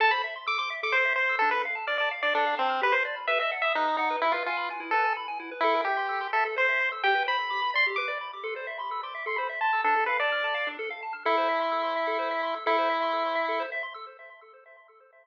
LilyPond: <<
  \new Staff \with { instrumentName = "Lead 1 (square)" } { \time 3/4 \key a \minor \tempo 4 = 128 a''16 b''16 r8 d'''16 d'''16 r16 d'''16 c''8 c''8 | a'16 b'16 r8 d''16 d''16 r16 d''16 d'8 c'8 | b'16 c''16 r8 e''16 e''16 r16 e''16 dis'8 dis'8 | e'16 f'16 f'8 r8 a'8 r4 |
e'8 g'4 a'16 r16 c''8. r16 | g''8 b''4 c'''16 r16 d'''8. r16 | c'''8. b''8 d'''8 c'''16 b''16 r16 a''8 | a'8 b'16 d''4~ d''16 r4 |
e'2. | e'2~ e'8 r8 | }
  \new Staff \with { instrumentName = "Lead 1 (square)" } { \time 3/4 \key a \minor a'16 c''16 e''16 c'''16 e'''16 c'''16 e''16 a'16 c''16 e''16 c'''16 e'''16 | d'16 a'16 f''16 a''16 f'''16 a''16 f''16 d'16 a'16 f''16 a''16 f'''16 | g'16 b'16 d''16 b''16 b'16 dis''16 fis''16 dis'''16 fis'''16 dis'''16 fis''16 b'16 | e'16 b'16 gis''16 b''16 gis''16 e'16 b'16 gis''16 b''16 gis''16 e'16 b'16 |
a'16 bes'16 e''16 c'''16 e'''16 c'''16 e''16 a'16 c''16 e''16 c'''16 e'''16 | g'16 b'16 c''16 b''16 d'''16 b''16 d''16 g'16 b'16 d''16 b''16 d'''16 | a'16 c''16 e''16 c'''16 e'''16 c'''16 e''16 a'16 c''16 e''16 c'''16 e'''16 | d'16 a'16 f''16 a''16 f'''16 a''16 f''16 d'16 a'16 f''16 a''16 f'''16 |
a'16 c''16 e''16 c'''16 e'''16 c'''16 e''16 a'16 c''16 e''16 c'''16 e'''16 | a'16 c''16 e''16 c'''16 e'''16 c'''16 e''16 a'16 c''16 e''16 c'''16 e'''16 | }
>>